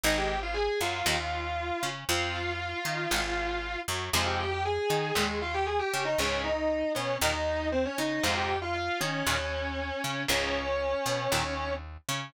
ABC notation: X:1
M:4/4
L:1/16
Q:1/4=117
K:Fm
V:1 name="Distortion Guitar"
[Ee] [Gg]2 [Ff] [Aa]2 [Ff]10 | [Ff]14 z2 | [Ff] [Gg] [Gg] [Gg] [Aa]4 [A,A]2 [Ff] [Gg] [Aa] [Gg]2 [Ee] | [Dd]2 [Ee]4 [Dd]2 [Ee]4 [Cc] [Dd] [Ee]2 |
[Ff] [Gg]2 [Ff] [Ff]2 [Dd]10 | [Dd]12 z4 |]
V:2 name="Overdriven Guitar"
[E,A,]3 z3 _G,2 [E,=G,B,] z5 D2 | [F,C]3 z3 E2 [E,A,] z5 _G,2 | [C,F,A,]3 z3 E2 [B,,E,] z5 D2 | [A,,D,]3 z3 =B,2 [_B,,E,] z5 D2 |
[A,,C,F,]3 z3 E2 [B,,E,] z5 D2 | [A,,D,]3 z3 =B,2 [_B,,E,] z5 D2 |]
V:3 name="Electric Bass (finger)" clef=bass
A,,,6 _G,,2 E,,6 D,2 | F,,6 E,2 A,,,6 _G,,2 | F,,6 E,2 E,,6 D,2 | D,,6 =B,,2 E,,6 D,2 |
F,,6 E,2 E,,6 D,2 | D,,6 =B,,2 E,,6 D,2 |]